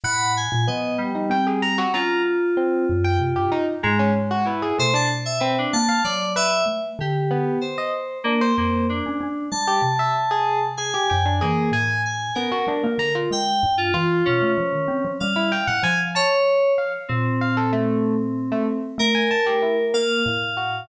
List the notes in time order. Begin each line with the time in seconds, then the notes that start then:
0.03 A2 F#5 B5
0.37 G#5
0.52 A#2
0.67 F3 B3 D#5
0.98 G3
1.15 D#4
1.30 C4 G5
1.47 G#4
1.62 A#5
1.78 F#4
1.94 C#4 F4 A#5
2.57 C4
2.89 F#2
3.04 G5
3.19 C3
3.36 G2 G4
3.52 D#4
3.83 G#2 G#3 A#5
3.99 C#4
4.15 G#3
4.31 F#4
4.45 E4 B4
4.62 G#4
4.78 B2 A3 C5
4.94 D4 A5
5.25 E5
5.40 C4 B4
5.58 D4
5.73 A#3 A5
5.89 F5
6.04 F#3 D5
6.36 B4 E5
6.66 A3
6.99 D3 G4
7.31 B3
7.61 C5
7.78 D#5
8.24 A#3 D4
8.41 C5
8.57 F2 A#3 C5
8.89 D4
9.06 C#4
9.21 C#4
9.51 G3 A5
9.67 G4
9.82 C3
9.99 E5
10.31 G#4
10.77 G#4 G#5
10.94 G4
11.10 F#2 G5
11.26 D4
11.41 E3 A#3 G#4
11.71 A2 G#5
12.06 G#5
12.35 B3 C#4 A#4
12.52 F#4
12.67 G3 D4
12.83 A#3
12.98 D3 A#5
13.15 F4
13.31 G#3 G5
13.63 G2
13.78 F4
13.93 E3 F4
14.25 B2 C#4
14.41 A3
14.58 F3
14.72 D#3
14.88 C4
15.04 F3
15.20 G3 F5
15.36 E4
15.52 G5
15.67 A2 F#5
15.83 F3 G#5
16.15 C#5 A5
16.78 F5
17.08 A#2 C4
17.41 F5
17.57 A4
17.73 A3
18.52 A3
18.98 A3 A#4
19.15 G#5
19.31 A5
19.46 G4
19.62 E4
19.94 A#3 F5
20.26 A2
20.57 F#4